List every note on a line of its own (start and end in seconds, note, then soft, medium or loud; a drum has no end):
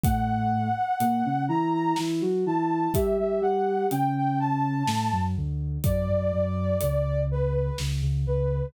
0.03 0.68 A2 medium
0.03 0.68 A3 medium
0.03 1.44 F#5 loud
0.03 kick loud
0.03 closed hi-hat loud
1.00 1.23 A#2 medium
1.00 1.23 A#3 medium
1.00 closed hi-hat loud
1.25 1.48 C#3 medium
1.25 1.48 C#4 medium
1.48 1.93 E3 medium
1.48 1.93 E4 medium
1.48 1.71 A#5 loud
1.73 1.96 A#5 loud
1.96 2.22 E3 medium
1.96 2.22 E4 medium
1.96 snare loud
2.21 2.44 F#3 medium
2.21 2.44 F#4 medium
2.46 2.88 E3 medium
2.46 2.88 E4 medium
2.46 2.93 A5 loud
2.94 3.17 G3 medium
2.94 3.17 G4 medium
2.94 3.17 E5 loud
2.94 kick loud
2.94 closed hi-hat loud
3.18 3.41 G3 medium
3.18 3.41 G4 medium
3.18 3.41 E5 medium
3.41 3.86 G3 medium
3.41 3.86 G4 medium
3.41 3.87 F#5 loud
3.91 4.83 C#3 medium
3.91 4.83 C#4 medium
3.91 4.14 G5 loud
3.91 closed hi-hat loud
4.16 4.39 G5 loud
4.40 5.22 A5 loud
4.86 5.09 A2 medium
4.86 5.09 A3 medium
4.86 snare loud
5.12 5.35 F#2 medium
5.12 5.35 F#3 medium
5.37 5.78 D2 medium
5.37 5.78 D3 medium
5.84 6.08 F#2 medium
5.84 6.08 F#3 medium
5.84 7.21 D5 loud
5.84 kick loud
5.84 closed hi-hat loud
6.08 6.31 F#2 medium
6.08 6.31 F#3 medium
6.32 6.76 F#2 medium
6.32 6.76 F#3 medium
6.81 7.70 C#2 medium
6.81 7.70 C#3 medium
6.81 closed hi-hat loud
7.31 7.53 B4 loud
7.54 7.77 B4 loud
7.78 8.01 C#2 medium
7.78 8.01 C#3 medium
7.78 snare loud
8.02 8.25 C#2 medium
8.02 8.25 C#3 medium
8.26 8.66 C#2 medium
8.26 8.66 C#3 medium
8.26 8.67 B4 medium